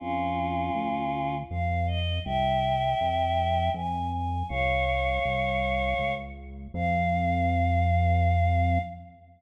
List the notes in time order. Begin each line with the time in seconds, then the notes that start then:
0.00 F2 C#4 F4
0.75 D2
1.50 F2 F5
1.87 D#5
2.25 C2 E5 G5
3.01 F2
3.74 F2 G#5
4.11 G#5
4.49 C2 C#5 F5
5.25 C2
5.99 C#2
6.74 F2 F5